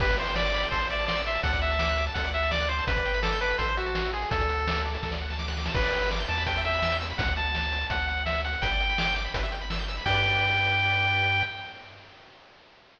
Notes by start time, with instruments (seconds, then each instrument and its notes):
0.00 synth bass 1 G1, lead 1 (square) G4 B4, kick, crash
0.09 lead 1 (square) B4, kick, closed hi-hat
0.17 lead 1 (square) C5 D5, closed hi-hat
0.27 lead 1 (square) G5, closed hi-hat
0.35 lead 1 (square) D5 B5, snare
0.45 lead 1 (square) D6, closed hi-hat
0.54 lead 1 (square) B5, closed hi-hat
0.63 lead 1 (square) G5, closed hi-hat
0.71 synth bass 1 A1, lead 1 (square) A4 C5, kick, closed hi-hat
0.81 lead 1 (square) C5, closed hi-hat
0.90 lead 1 (square) D5 E5, closed hi-hat
0.99 lead 1 (square) A5, closed hi-hat
1.07 lead 1 (square) D5 C6, snare
1.16 lead 1 (square) E6, closed hi-hat
1.26 lead 1 (square) E5 C6, closed hi-hat
1.35 lead 1 (square) A5, closed hi-hat
1.43 synth bass 1 D2, lead 1 (square) A4 F#5, kick, closed hi-hat
1.53 lead 1 (square) D5, kick, closed hi-hat
1.62 lead 1 (square) E5 F#5, closed hi-hat
1.71 lead 1 (square) A5, closed hi-hat
1.79 lead 1 (square) D6, snare
1.88 lead 1 (square) F#6, closed hi-hat
1.98 lead 1 (square) D6, closed hi-hat
2.07 lead 1 (square) A5, closed hi-hat
2.14 synth bass 1 D2, lead 1 (square) A4 F#5, kick, closed hi-hat
2.24 lead 1 (square) D5, closed hi-hat
2.33 lead 1 (square) E5 F#5, closed hi-hat
2.43 lead 1 (square) A5, closed hi-hat
2.51 lead 1 (square) D5 D6, snare
2.60 lead 1 (square) F#6, closed hi-hat
2.69 lead 1 (square) C5 D6, closed hi-hat
2.78 lead 1 (square) A5, closed hi-hat
2.87 synth bass 1 G1, lead 1 (square) B4, kick, closed hi-hat
2.96 lead 1 (square) D5, kick, closed hi-hat
3.05 lead 1 (square) G5, closed hi-hat
3.14 lead 1 (square) B5, closed hi-hat
3.22 lead 1 (square) A4 D6, snare
3.32 lead 1 (square) G6, closed hi-hat
3.41 lead 1 (square) B4 D6, closed hi-hat
3.50 lead 1 (square) B5, closed hi-hat
3.58 synth bass 1 A1, lead 1 (square) A4 C5, kick, closed hi-hat
3.68 lead 1 (square) C5, closed hi-hat
3.77 lead 1 (square) F#4 E5, closed hi-hat
3.86 lead 1 (square) A5, closed hi-hat
3.95 lead 1 (square) C6, snare
4.05 lead 1 (square) E6, closed hi-hat
4.13 lead 1 (square) G#4 C6, closed hi-hat
4.22 lead 1 (square) A5, closed hi-hat
4.31 synth bass 1 D2, lead 1 (square) A4, kick, closed hi-hat
4.40 lead 1 (square) D5, kick, closed hi-hat
4.49 lead 1 (square) F#5, closed hi-hat
4.58 lead 1 (square) A5, closed hi-hat
4.67 lead 1 (square) D6, snare
4.76 lead 1 (square) F#6, closed hi-hat
4.85 lead 1 (square) D6, closed hi-hat
4.94 lead 1 (square) A5, closed hi-hat
5.03 synth bass 1 D2, lead 1 (square) A4, kick, snare
5.12 lead 1 (square) D5, snare
5.21 lead 1 (square) F#5
5.30 lead 1 (square) A5, snare
5.39 lead 1 (square) D6, snare
5.48 lead 1 (square) F#6, snare
5.57 lead 1 (square) D6, snare
5.65 lead 1 (square) A5, snare
5.74 synth bass 1 G1, lead 1 (square) B4, kick, crash
5.84 lead 1 (square) D5, closed hi-hat
5.93 lead 1 (square) G5, closed hi-hat
6.02 lead 1 (square) B5, closed hi-hat
6.11 lead 1 (square) D6, snare
6.19 lead 1 (square) G6, closed hi-hat
6.28 synth bass 1 E2, lead 1 (square) A5 D6, closed hi-hat
6.37 lead 1 (square) B5, closed hi-hat
6.46 lead 1 (square) B4 G5, kick, closed hi-hat
6.56 lead 1 (square) E5, closed hi-hat
6.65 lead 1 (square) E5 G5, closed hi-hat
6.73 lead 1 (square) B5, closed hi-hat
6.82 lead 1 (square) E6, snare
6.92 lead 1 (square) G6, closed hi-hat
7.00 lead 1 (square) E6, closed hi-hat
7.10 lead 1 (square) B5, closed hi-hat
7.18 synth bass 1 D2, lead 1 (square) F#5, kick, closed hi-hat
7.27 kick, closed hi-hat
7.36 lead 1 (square) A5, closed hi-hat
7.45 closed hi-hat
7.55 snare
7.63 closed hi-hat
7.72 closed hi-hat
7.81 closed hi-hat
7.90 synth bass 1 D2, lead 1 (square) F#5, kick, closed hi-hat
7.99 closed hi-hat
8.07 lead 1 (square) F#5, closed hi-hat
8.17 closed hi-hat
8.26 lead 1 (square) E5, snare
8.35 closed hi-hat
8.44 lead 1 (square) F#5, closed hi-hat
8.53 closed hi-hat
8.62 synth bass 1 G1, lead 1 (square) B4 G5, kick, closed hi-hat
8.71 lead 1 (square) D5, closed hi-hat
8.80 lead 1 (square) G5, closed hi-hat
8.89 lead 1 (square) B5, closed hi-hat
8.98 lead 1 (square) D6, snare
9.07 lead 1 (square) G6, closed hi-hat
9.16 lead 1 (square) D6, closed hi-hat
9.25 lead 1 (square) B5, closed hi-hat
9.34 synth bass 1 G1, lead 1 (square) B4, kick, closed hi-hat
9.43 lead 1 (square) E5, closed hi-hat
9.52 lead 1 (square) G5, closed hi-hat
9.61 lead 1 (square) B5, closed hi-hat
9.70 lead 1 (square) E6, snare
9.79 lead 1 (square) G6, closed hi-hat
9.88 lead 1 (square) E6, closed hi-hat
9.97 lead 1 (square) B5, open hi-hat
10.06 synth bass 1 G2, lead 1 (square) G4 B4 D5 G5, kick, crash